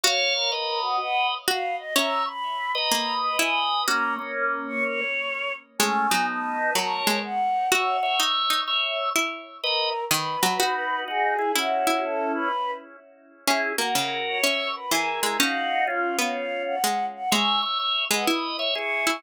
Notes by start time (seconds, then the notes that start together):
0.04 F#4 C#5 F5
0.35 A#4
0.52 B4 D#5
0.82 F#4
1.00 F#5
1.48 F#4 F5
1.79 D#5
1.96 C#4 C#5 E5 A#5
2.26 B5
2.75 B4 D#5 A#5
2.92 A#3
3.23 B5
3.39 E4 G#5
3.87 A#3 C#4 F#4 A#5
4.19 A#3 C#4
4.68 C#6
4.84 C#5
5.79 G#3 A3 C#4 G#5
6.11 F#3 B3 D#4
6.28 A5
6.75 F#3 A#4 C#5
7.07 G#3
7.23 F#5
7.71 F#4 C#5 E5 F#5
8.03 C#5 E5
8.20 D#4
8.50 D#4
8.68 C#5 E5
9.16 E4
9.63 A#4 B4 D#5
10.11 D#3 B4
10.43 F#3
10.60 D#4 F#4
11.08 D#4 F#4 G#4
11.39 E4 G#4
11.55 C#4 E4 F#4
11.87 E4
12.03 A4
12.34 B4
13.47 C#4 E4 G#4
13.78 A#3 F#4 A#4
13.95 C#3
14.27 C#5
14.43 C#4 C#5 E5
14.76 B4
14.91 E3 E4 G#4 A#4
15.23 G#3 E4 G#4
15.39 C#4 D#4 F#4 F5
15.87 C#4 F4
16.19 B3
16.36 F5
16.66 F#5
16.84 G#3
17.15 F#5
17.31 G#3 C#5 E5 G#5
17.62 C#5 E5
17.79 C#5 E5
18.11 G#3 B4 D#5 F#5
18.27 E4
18.59 C#5 E5
18.75 E4 G#4 C#6
19.07 E4